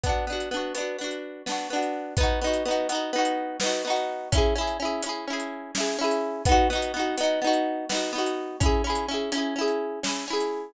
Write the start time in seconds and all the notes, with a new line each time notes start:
0.03 B3 D4, kick, closed hi-hat
0.09 F#4
0.27 B3 D4
0.33 F#4
0.40 closed hi-hat
0.51 B3 D4
0.57 F#4
0.75 B3 D4, closed hi-hat
0.80 F#4
0.98 B3 D4
1.04 F#4
1.11 closed hi-hat
1.46 B3 D4, snare
1.52 F#4
1.70 B3 D4
1.76 F#4
1.82 closed hi-hat
2.17 B3 D#4, kick, closed hi-hat
2.23 F#4
2.41 B3 D#4
2.47 F#4
2.53 closed hi-hat
2.65 B3 D#4
2.71 F#4
2.89 B3 D#4, closed hi-hat
2.95 F#4
3.13 B3 D#4
3.18 F#4
3.25 closed hi-hat
3.60 B3 D#4, snare
3.66 F#4
3.85 B3 D#4
3.90 F#4
3.96 closed hi-hat
4.32 C#4 E4, kick, closed hi-hat
4.38 G#4
4.55 C#4 E4
4.61 G#4
4.67 closed hi-hat
4.80 C#4 E4
4.85 G#4
5.02 C#4 E4, closed hi-hat
5.09 G#4
5.27 C#4 E4
5.33 G#4
5.40 closed hi-hat
5.75 C#4 E4, snare
5.80 G#4
5.99 C#4 E4
6.04 G#4
6.11 closed hi-hat
6.45 B3 D#4, kick, closed hi-hat
6.52 F#4
6.70 B3 D#4
6.75 F#4
6.82 closed hi-hat
6.94 B3 D#4
6.99 F#4
7.17 B3 D#4, closed hi-hat
7.23 F#4
7.42 B3 D#4
7.47 F#4
7.53 closed hi-hat
7.89 B3 D#4, snare
7.95 F#4
8.13 B3 D#4
8.18 F#4
8.26 closed hi-hat
8.60 C#4 E4, kick, closed hi-hat
8.66 G#4
8.84 C#4 E4
8.90 G#4
8.95 closed hi-hat
9.08 C#4 E4
9.14 G#4
9.32 C#4 E4, closed hi-hat
9.38 G#4
9.56 C#4 E4
9.61 G#4
9.68 closed hi-hat
10.03 C#4 E4, snare
10.09 G#4
10.28 C#4 E4
10.33 G#4
10.40 closed hi-hat